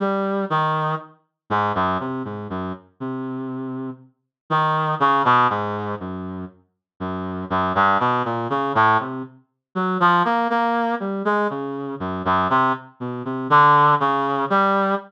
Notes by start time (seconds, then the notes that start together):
0.00 G3
0.50 D#3
1.50 G#2
1.75 F#2
2.00 C3
2.25 G#2
2.50 F#2
3.00 C3
4.50 D#3
5.00 C#3
5.25 B2
5.50 G#2
6.00 F#2
7.00 F#2
7.50 F#2
7.75 G2
8.00 B2
8.25 A#2
8.50 C#3
8.75 A2
9.00 C3
9.75 F#3
10.00 F3
10.25 A#3
10.50 A#3
11.00 G3
11.25 G#3
11.50 C#3
12.00 F#2
12.25 F#2
12.50 C3
13.00 B2
13.25 C3
13.50 D3
14.00 C#3
14.50 G3